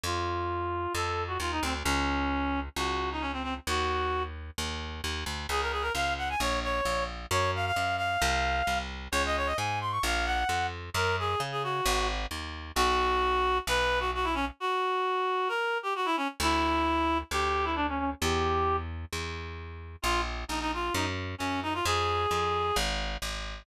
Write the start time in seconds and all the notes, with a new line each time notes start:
0.04 F2 F4
0.94 F2 A4
1.27 F#4
1.40 D#2 F4
1.52 D#4
1.63 D2 C4
1.84 C#2 C#4
2.76 C#2 F#4
3.12 D#4
3.21 C#4
3.33 C4
3.43 C4
3.67 D#2 F#4
4.58 D#2
5.04 D#2
5.26 D2
5.49 C#2 G#4
5.61 A#4
5.72 G#4
5.82 A#4
5.94 C#2 F5
6.18 F#5
6.30 G#5
6.40 A#1 C#5
6.64 C#5
6.85 A#1
7.31 F#2 C#5
7.56 F5
7.66 F5
7.76 F#2
7.97 F5
8.22 C2
8.67 C2
9.12 C#2 C#5
9.26 D#5
9.37 C#5
9.46 D#5
9.57 G#2 G#5
9.81 C6
9.91 C#6
10.03 A#1 F5
10.26 F#5
10.49 F2
10.94 F#2 A#4
11.19 G#4
11.40 C#3
11.52 G#4
11.63 F#4
11.86 G#1
12.31 D#2
12.76 B1 F#4
13.67 B1 B4
14.00 F#4
14.15 F#4
14.24 E4
14.34 C#4
14.60 F#4
15.48 A#4
15.83 G4
15.95 F#4
16.05 E4
16.17 C#4
16.40 D2 E4
17.31 D2 G4
17.65 E4
17.76 D4
17.89 C#4
17.99 C#4
18.21 E2 G4
19.13 E2
20.02 A#1 F4
20.48 A#1 D#4
20.61 D#4
20.74 F4
20.94 F#2 D#4
21.38 F#2 C#4
21.63 D#4
21.74 F4
21.85 F2 G#4
22.31 F2
22.76 G#1
23.22 G#1